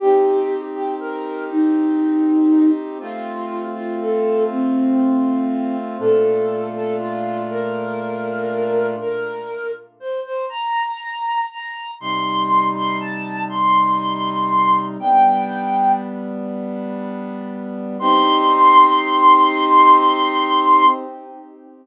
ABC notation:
X:1
M:12/8
L:1/8
Q:3/8=80
K:Cdor
V:1 name="Flute"
G3 G B2 E6 | F3 F A2 C6 | A3 A F2 B6 | B3 z c c b4 b2 |
c'3 c' a2 c'6 | g4 z8 | c'12 |]
V:2 name="Brass Section"
[CEG]12 | [A,CF]12 | [B,,A,DF]12 | z12 |
[C,G,E]12 | [G,=B,D]12 | [CEG]12 |]